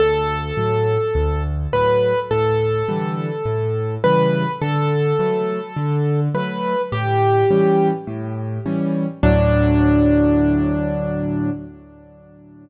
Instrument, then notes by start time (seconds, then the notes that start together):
acoustic grand piano
0.00 D2 A4
0.57 A2 F#3
1.15 D2
1.73 A2 F#3 B4
2.31 A2 A4
2.88 D3 E3 G3
3.45 A2
4.04 C#3 E3 G3 B4
4.62 D3 A4
5.19 F#3 A3
5.77 D3
6.34 F#3 A3 B4
6.92 A2 G4
7.51 E3 G3 C#4
8.07 A2
8.66 E3 G3 C#4
9.23 D2 A2 F#3 D4